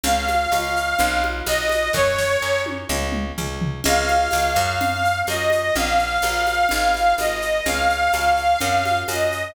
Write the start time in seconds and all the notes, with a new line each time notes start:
0.03 C#2 F5, low conga, shaker
0.28 high conga, shaker
0.51 C#2, tambourine, high conga, shaker
0.76 shaker
0.98 B1, low conga, shaker
1.24 high conga
1.46 B1 D#5, tambourine, high conga, shaker
1.69 high conga, shaker
1.93 F#2 C#5, kick, snare
2.18 snare
2.42 F#2
2.66 high tom
2.89 C#2, mid tom
3.12 mid tom
3.38 C#2, floor tom
3.62 floor tom
3.84 C#2 F5, crash, low conga, shaker
4.08 high conga, shaker
4.31 C#2, tambourine, high conga, shaker
4.56 F#2, high conga, shaker
4.80 low conga, shaker
5.05 shaker
5.27 F#2 D#5, tambourine, high conga, shaker
5.50 high conga, shaker
5.75 A#1 F5, low conga, shaker
5.99 shaker
6.22 A#1, tambourine, high conga, shaker
6.47 high conga, shaker
6.69 G#1, low conga, shaker
6.94 high conga, shaker
7.18 G#1 D#5, tambourine, high conga, shaker
7.42 shaker
7.66 C#2 F5, low conga, shaker
7.89 shaker
8.12 C#2, tambourine, high conga, shaker
8.37 shaker
8.60 F#2, low conga, shaker
8.85 high conga, shaker
9.08 F#2 D#5, tambourine, high conga, shaker
9.32 shaker